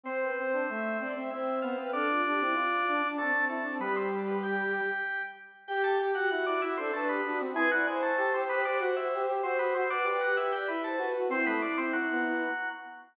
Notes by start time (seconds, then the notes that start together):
0.04 C4 C5
0.21 B4
0.36 C4 C5
0.53 D4
0.69 A3 E5
1.00 C4 D5
1.15 C4 E5
1.31 C4 E4 C5 E5
1.61 B3 F4 C5 F5
1.76 C4 B4
1.91 D4 A4 D5
2.10 F4
2.25 D4 G4
2.39 C4 E4
2.53 F4
2.88 D4
3.02 D4
3.17 A3 C4 D4 A4
3.32 C4
3.48 A3 E4 A4
3.63 C4 D4
3.79 G3 B3 G4 B4
3.96 C4 C5
4.28 B3 B4
4.43 G4 G5
5.67 G4 G5
5.84 G4 A4 A5
5.99 G4 G5
6.14 F#4 F#5
6.29 E4 F#4 F#5
6.46 D4 E4 D5
6.62 E4 E5
6.76 C4 D4 A4 C5
6.92 A3 D4 A4 B4
7.07 B3 G4 B4
7.24 D4 F#4
7.40 C4
7.54 G#3 E4 G#4 B4
7.71 F#3 E4 F#4 D5
7.86 G#3 E4 G#4 C5
8.02 A3 A4
8.17 A3 G4 A4
8.34 C4 G4 C5
8.49 B3 G4 B4
8.65 D4 G4 D5
8.79 F#4 F#5
8.96 E4 E5
9.13 G4
9.26 G4
9.42 C4 F#4 C5
9.59 B3 F#4 B4
9.74 C4 F#4 C5
9.90 D4 B4 D5
10.04 D4 G4 B4 D5
10.21 F#4 G4 F#5
10.37 E4 G4 E5
10.52 G4 D5 G5
10.67 E4 B4 E5 B5
10.84 A4 C5 A5
10.97 F#4 B4
11.14 F#4
11.29 C4 E4 C5
11.46 A3 B3 B4
11.62 D4 D5
11.77 C4 C5
11.93 F#3 F#4
12.11 B3